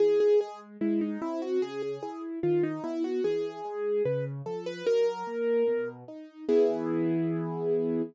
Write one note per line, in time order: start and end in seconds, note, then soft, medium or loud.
0.00 0.36 E3 medium
0.00 0.19 G#4 loud
0.20 0.39 G#4 loud
0.41 0.77 G#3 medium
0.41 0.60 G#4 medium
0.81 1.18 G#3 medium
0.81 1.00 E4 medium
1.01 1.20 D#4 medium
1.22 1.58 C4 medium
1.22 1.41 E4 loud
1.42 1.61 F#4 medium
1.62 1.99 C#3 medium
1.62 1.81 G#4 loud
1.82 2.02 G#4 medium
2.03 2.39 E4 medium
2.03 2.22 G#4 medium
2.43 2.80 D#3 medium
2.43 2.63 F4 medium
2.63 2.83 D#4 loud
2.84 3.20 B3 medium
2.84 3.03 E4 loud
3.04 3.23 F#4 medium
3.24 3.61 E3 medium
3.24 4.03 G#4 loud
3.65 4.01 G#3 medium
4.05 4.42 C#3 medium
4.05 4.25 B4 medium
4.46 4.82 F3 medium
4.46 4.65 A4 medium
4.66 4.85 B4 loud
4.86 5.23 F#3 medium
4.86 5.89 A#4 loud
5.27 5.64 A#3 medium
5.68 6.04 B2 medium
6.08 6.45 D#4 medium
6.49 8.02 E3 loud
6.49 8.02 B3 medium
6.49 8.02 E4 loud
6.49 8.02 G#4 medium